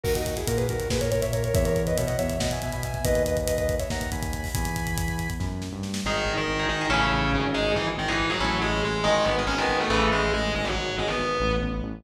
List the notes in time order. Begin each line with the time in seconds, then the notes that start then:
0.04 D#2 F#4 A#4, kick, crash
0.15 D#4 F#4, kick, closed hi-hat
0.26 kick, closed hi-hat
0.37 E4 G#4, kick, closed hi-hat
0.47 A#2 F#4 A#4, kick, closed hi-hat
0.57 G#4 B4, kick, closed hi-hat
0.69 D#2 F#4 A#4, kick, closed hi-hat
0.80 kick, closed hi-hat
0.90 A#2 G#4 B4, kick, snare
1.01 A#4 C#5, kick, closed hi-hat
1.11 A#2 A#4 C#5, kick, closed hi-hat
1.22 C#5 E5, kick, closed hi-hat
1.33 A#4 C#5, kick, closed hi-hat
1.44 A#4 C#5, kick, closed hi-hat
1.54 E2 C#5 E5, kick, closed hi-hat
1.64 A#4 C#5, kick, closed hi-hat
1.76 kick, closed hi-hat
1.87 B4 D#5, kick, closed hi-hat
1.97 B2 C#5 E5, kick, closed hi-hat
2.07 D#5 F#5, kick, closed hi-hat
2.18 E2 C#5 E5, kick, closed hi-hat
2.30 kick, closed hi-hat
2.40 B2 D#5 F#5, kick, snare
2.51 E5 G#5, kick, closed hi-hat
2.62 B2 E5 G#5, kick, closed hi-hat
2.72 G#5 B5, kick, closed hi-hat
2.83 E5 G#5, kick, closed hi-hat
2.94 E5 G#5, kick, closed hi-hat
3.05 D#2 B4 D#5, kick, closed hi-hat
3.15 kick, closed hi-hat
3.26 B4 D#5, kick, closed hi-hat
3.37 kick, closed hi-hat
3.47 B4 D#5, kick, closed hi-hat
3.57 B4 D#5, kick, closed hi-hat
3.69 kick, closed hi-hat
3.79 C#5 E5, kick, closed hi-hat
3.90 D#2 F#5 A#5, kick, snare
4.01 kick, closed hi-hat
4.12 D#2 G#5 B5, kick, closed hi-hat
4.23 kick, closed hi-hat
4.33 kick, closed hi-hat
4.44 kick, open hi-hat
4.54 E2 G#5 B5, kick, closed hi-hat
4.65 kick, closed hi-hat
4.76 kick, closed hi-hat
4.87 kick, closed hi-hat
4.97 kick, closed hi-hat
5.08 kick, closed hi-hat
5.19 kick, closed hi-hat
5.30 kick, closed hi-hat
5.39 F#2, kick, snare
5.62 snare
5.72 G2
5.83 snare
5.94 snare
6.05 G#1 D#3 D#4 G#4
6.26 G#1
6.37 D#3 D#4
6.48 G#1
6.59 D#4 G#4
6.69 G#1 D#3 D#4
6.81 D#4 G#4
6.90 A1 C#3 C#4 E4 A4
7.12 A1
7.33 G#1
7.54 G#3 D#4 G#4
7.76 G#1 E3 E4
7.97 G#1 D#3 D#4
8.08 E3 D#4 E4 G#4
8.19 G#1
8.30 F#3 D#4 F#4 G#4
8.40 A1 C#4 E4 A4
8.62 A1 G#3 G#4
8.84 A1 G#3 G#4
9.04 G#1 D#3 G#3 G#4
9.25 G#1 B3 B4
9.39 D#3 G#3
9.47 G#1 D#3 G#3 C#4 C#5
9.58 D#3 G#3 B3 B4
9.69 G#1
9.80 A3 A4
9.90 A1 C#3 E3 A3
10.12 A1 G#3 G#4
10.33 A1 G#3 G#4
10.54 G#1 G#3 G#4
10.65 F#3 F#4
10.75 G#1
10.98 G#1 G#3 G#4
11.07 B3 B4
11.19 G#1
11.40 A1
11.62 A1
11.82 A1